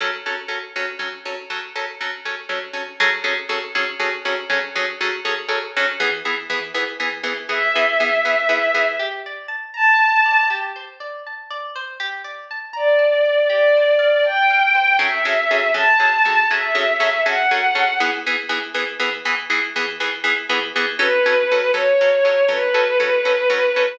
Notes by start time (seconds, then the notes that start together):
0.00 F#3 C#4 A4
0.26 F#3 C#4 A4
0.48 F#3 C#4 A4
0.76 F#3 C#4 A4
0.99 F#3 C#4 A4
1.25 F#3 C#4 A4
1.50 F#3 C#4 A4
1.76 F#3 C#4 A4
2.01 F#3 C#4 A4
2.25 F#3 C#4 A4
2.49 F#3 C#4 A4
2.73 F#3 C#4 A4
3.00 F#3 C#4 G#4 A4
3.24 F#3 C#4 G#4 A4
3.49 F#3 C#4 G#4 A4
3.75 F#3 C#4 G#4 A4
3.99 F#3 C#4 G#4 A4
4.25 F#3 C#4 G#4 A4
4.50 F#3 C#4 G#4 A4
4.75 F#3 C#4 G#4 A4
5.01 F#3 C#4 G#4 A4
5.25 F#3 C#4 G#4 A4
5.49 F#3 C#4 G#4 A4
5.76 F#3 C#4 G#4 A4
6.00 E3 B3 G#4
6.25 E3 B3 G#4
6.50 E3 B3 G#4
6.74 E3 B3 G#4
7.00 E3 B3 G#4
7.23 E3 B3 G#4
7.49 E3 B3 G#4 E5
7.75 E3 B3 G#4
8.00 E3 B3 G#4
8.25 E3 B3 G#4
8.49 E3 B3 G#4
8.74 E3 B3 G#4
8.99 G4
9.26 D5
9.48 A5
9.74 A5 A#5
10.01 A5
10.26 D5
10.50 G4
10.76 C5
11.00 D5
11.27 A5
11.51 D5
11.76 C5
12.00 G4
12.24 D5
12.51 A5
12.73 D5 A#5
12.99 A5
13.25 D5
13.50 G4 D5
13.77 C5
13.99 F5
14.24 G5 A5
14.50 F5
14.75 C5
14.99 F#3 C#4 G#4 A4 E5
15.25 F#3 C#4 G#4 A4
15.51 F#3 C#4 G#4 A4
15.74 F#3 C#4 G#4 A4 A5
15.99 F#3 C#4 G#4 A4
16.25 F#3 C#4 G#4 A4
16.49 F#3 C#4 G#4 A4 E5
16.75 F#3 C#4 G#4 A4
17.00 F#3 C#4 G#4 A4
17.26 F#3 C#4 G#4 A4 F#5
17.51 F#3 C#4 G#4 A4
17.75 F#3 C#4 G#4 A4
18.00 E3 B3 G#4
18.26 E3 B3 G#4
18.49 E3 B3 G#4
18.74 E3 B3 G#4
18.99 E3 B3 G#4
19.25 E3 B3 G#4
19.50 E3 B3 G#4
19.76 E3 B3 G#4
20.00 E3 B3 G#4
20.24 E3 B3 G#4
20.49 E3 B3 G#4
20.76 E3 B3 G#4
20.99 F#3 C#4 A4 B4
21.26 F#3 C#4 A4
21.51 F#3 C#4 A4
21.74 F#3 C#4 A4 C#5
22.01 F#3 C#4 A4
22.25 F#3 C#4 A4
22.48 F#3 C#4 A4 B4
22.74 F#3 C#4 A4
23.00 F#3 C#4 A4
23.25 F#3 C#4 A4
23.50 F#3 C#4 A4
23.76 F#3 C#4 A4